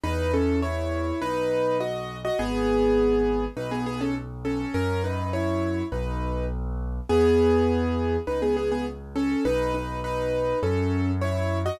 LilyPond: <<
  \new Staff \with { instrumentName = "Acoustic Grand Piano" } { \time 4/4 \key e \major \tempo 4 = 102 <dis' b'>8 <cis' a'>8 <e' cis''>4 <dis' b'>4 <fis' dis''>8. <fis' dis''>16 | <b gis'>2 <dis' b'>16 <b gis'>16 <b gis'>16 <cis' a'>16 r8 <cis' a'>8 | <cis' ais'>8 <dis' b'>8 <e' cis''>4 <dis' b'>4 r4 | <b gis'>2 <dis' b'>16 <b gis'>16 <b gis'>16 <b gis'>16 r8 <cis' a'>8 |
<dis' b'>8 <dis' b'>8 <dis' b'>4 <cis' a'>4 <e' cis''>8. <fis' dis''>16 | }
  \new Staff \with { instrumentName = "Acoustic Grand Piano" } { \clef bass \time 4/4 \key e \major e,2 b,,2 | gis,,2 b,,2 | fis,2 b,,2 | e,2 cis,2 |
b,,2 fis,2 | }
>>